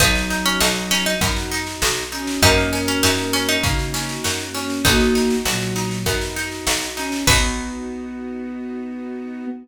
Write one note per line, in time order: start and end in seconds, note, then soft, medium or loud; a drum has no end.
0.00 0.55 B1 loud
0.00 1.15 F#3 medium
0.00 0.27 B3 loud
0.00 2.40 B3 medium
0.00 1.15 D#4 medium
0.00 2.40 D#4 loud
0.00 0.44 D#4 medium
0.00 2.40 F#4 loud
0.00 kick loud
0.00 snare medium
0.15 snare medium
0.30 0.58 D#4 medium
0.30 snare medium
0.45 0.60 C#4 medium
0.45 snare medium
0.60 1.16 B1 medium
0.60 0.87 D#4 medium
0.60 0.88 F#4 medium
0.60 snare loud
0.76 snare medium
0.91 1.05 C#4 medium
0.91 1.18 D#4 medium
0.91 snare medium
1.06 1.21 D#4 medium
1.06 snare medium
1.21 1.76 F#2 loud
1.21 1.48 B3 loud
1.21 2.03 D#4 medium
1.21 kick medium
1.21 snare medium
1.36 snare medium
1.52 1.79 D#4 loud
1.52 snare medium
1.67 snare medium
1.82 2.37 B1 loud
1.82 2.09 F#4 medium
1.82 snare loud
1.97 snare medium
2.12 2.40 C#4 medium
2.12 2.39 D#4 medium
2.12 snare medium
2.27 snare medium
2.42 2.97 F#2 loud
2.42 4.82 A#3 medium
2.42 2.70 A#3 loud
2.42 4.82 C#4 loud
2.42 3.57 C#4 medium
2.42 2.81 D#4 medium
2.42 4.82 F#4 loud
2.42 3.57 A#4 medium
2.42 kick medium
2.42 snare medium
2.58 snare medium
2.73 3.00 C#4 medium
2.73 snare medium
2.88 3.02 C#4 medium
2.88 snare medium
3.03 3.58 F#2 medium
3.03 3.32 D#4 medium
3.03 3.30 F#4 medium
3.03 snare loud
3.18 snare medium
3.33 3.48 C#4 medium
3.33 3.61 C#4 loud
3.33 snare medium
3.48 3.63 D#4 medium
3.48 snare medium
3.63 4.18 C#3 medium
3.63 3.91 A#3 medium
3.63 4.46 D#4 medium
3.63 kick loud
3.63 snare medium
3.79 snare medium
3.94 4.21 C#4 loud
3.94 snare medium
4.09 snare medium
4.24 4.80 F#2 medium
4.24 4.52 F#4 medium
4.24 snare loud
4.39 snare medium
4.54 4.82 C#4 medium
4.54 snare medium
4.70 snare medium
4.85 5.40 B1 loud
4.85 5.35 A#3 medium
4.85 5.12 B3 loud
4.85 7.25 B3 medium
4.85 5.98 D#4 medium
4.85 7.25 D#4 medium
4.85 5.35 F#4 medium
4.85 7.25 F#4 medium
4.85 kick loud
4.85 snare medium
5.00 snare medium
5.15 5.42 D#4 medium
5.15 snare medium
5.30 snare medium
5.45 6.00 B1 medium
5.45 6.03 A#2 medium
5.45 6.03 F#3 medium
5.45 5.73 F#4 loud
5.45 snare loud
5.61 snare medium
5.76 6.03 D#4 medium
5.76 snare medium
5.91 snare medium
6.06 6.61 F#2 medium
6.06 6.33 B3 loud
6.06 6.88 D#4 medium
6.06 kick medium
6.06 snare medium
6.21 snare medium
6.36 6.64 D#4 medium
6.36 snare medium
6.52 snare medium
6.67 7.21 B1 medium
6.67 6.94 F#4 medium
6.67 snare loud
6.82 snare medium
6.97 7.24 C#4 medium
6.97 7.24 D#4 medium
6.97 snare medium
7.12 snare medium
7.27 9.46 B1 loud
7.27 9.46 B3 loud
7.27 9.46 D#4 loud
7.27 9.46 F#4 loud
7.27 9.46 B4 loud
7.27 kick loud
7.27 crash loud
7.32 9.46 B3 loud